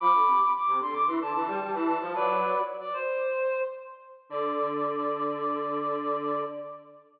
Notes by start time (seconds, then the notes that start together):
0.00 F3 B5 D6
0.14 D3
0.27 C3
0.54 D6
0.67 C3
0.80 D3 C6
0.93 D6
1.06 E3 C6
1.21 D3 A5
1.33 E3 A5
1.48 G3
1.62 G3
1.73 E3 A5
1.87 A5
2.00 F3
2.14 F#3 B4 D5
2.80 D5
2.93 C5
4.29 D3 D5